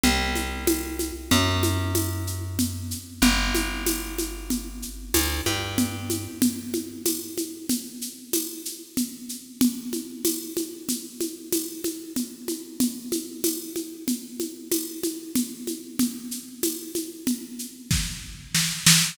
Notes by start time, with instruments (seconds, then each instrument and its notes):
0.03 electric bass (finger) C2, low conga, shaker
0.35 high conga, shaker
0.67 tambourine, high conga, shaker
0.99 high conga, shaker
1.31 electric bass (finger) F#2, low conga, shaker
1.63 high conga, shaker
1.95 tambourine, high conga, shaker
2.27 shaker
2.59 low conga, shaker
2.91 shaker
3.22 electric bass (finger) G1, low conga, shaker
3.55 high conga, shaker
3.86 tambourine, high conga, shaker
4.18 high conga, shaker
4.50 low conga, shaker
4.82 shaker
5.14 electric bass (finger) D2, tambourine, high conga, shaker
5.46 electric bass (finger) G2, high conga, shaker
5.78 low conga, shaker
6.10 high conga, shaker
6.42 low conga, shaker
6.74 high conga, shaker
7.06 tambourine, high conga, shaker
7.38 high conga, shaker
7.69 low conga, shaker
8.01 shaker
8.33 tambourine, high conga, shaker
8.65 shaker
8.97 low conga, shaker
9.29 shaker
9.61 low conga, shaker
9.93 high conga, shaker
10.25 tambourine, high conga, shaker
10.57 high conga, shaker
10.89 low conga, shaker
11.20 high conga, shaker
11.52 tambourine, high conga, shaker
11.84 high conga, shaker
12.16 low conga, shaker
12.48 high conga, shaker
12.80 low conga, shaker
13.12 high conga, shaker
13.44 tambourine, high conga, shaker
13.76 high conga, shaker
14.08 low conga, shaker
14.40 high conga, shaker
14.72 tambourine, high conga, shaker
15.03 high conga, shaker
15.35 low conga, shaker
15.67 high conga, shaker
15.99 low conga, shaker
16.31 shaker
16.63 tambourine, high conga, shaker
16.95 high conga, shaker
17.27 low conga, shaker
17.59 shaker
17.91 kick, snare
18.55 snare
18.86 snare